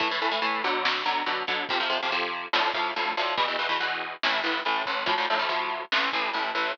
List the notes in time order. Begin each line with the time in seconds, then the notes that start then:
0.00 A2 E3 A3, kick, closed hi-hat
0.11 A2 E3 A3
0.20 A2 E3 A3, closed hi-hat
0.31 A2 E3 A3
0.42 A2 E3 A3, closed hi-hat
0.62 B2 D3 F#3, closed hi-hat
0.85 snare
1.06 B2 D3 F#3, closed hi-hat
1.26 B2 D3 F#3, closed hi-hat
1.47 B2 D3 F#3, kick, closed hi-hat
1.69 F2 C3 F3, kick, closed hi-hat
1.80 F2 C3 F3
1.90 F2 C3 F3, closed hi-hat
2.02 F2 C3 F3
2.11 F2 C3 F3, closed hi-hat
2.33 closed hi-hat
2.53 D2 A2 F3, snare
2.74 D2 A2 F3, kick, closed hi-hat
2.96 D2 A2 F3, closed hi-hat
3.17 D2 A2 F3, closed hi-hat
3.37 E2 B2 E3, kick, closed hi-hat
3.48 E2 B2 E3
3.59 E2 B2 E3, closed hi-hat
3.69 E2 B2 E3
3.80 E2 B2 E3, closed hi-hat
4.01 closed hi-hat
4.23 A1 A2 E3, snare
4.44 A1 A2 E3, closed hi-hat
4.65 A1 A2 E3, closed hi-hat
4.86 A1 A2 E3, kick, closed hi-hat
5.06 D2 A2 F3, kick, closed hi-hat
5.18 D2 A2 F3
5.29 D2 A2 F3, closed hi-hat
5.39 D2 A2 F3
5.49 D2 A2 F3, closed hi-hat
5.70 closed hi-hat
5.92 A1 A2 E3, snare
6.13 A1 A2 E3, kick, closed hi-hat
6.33 A1 A2 E3, closed hi-hat
6.55 A1 A2 E3, closed hi-hat